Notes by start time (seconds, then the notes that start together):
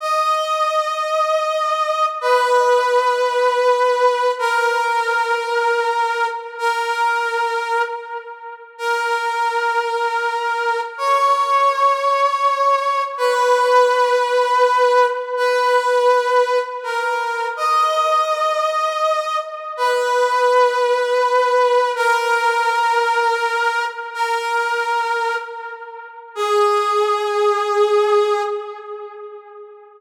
0.00 D#5
2.21 B4
4.39 A#4
6.58 A#4
8.78 A#4
10.98 C#5
13.17 B4
15.37 B4
16.83 A#4
17.56 D#5
19.77 B4
21.95 A#4
24.14 A#4
26.35 G#4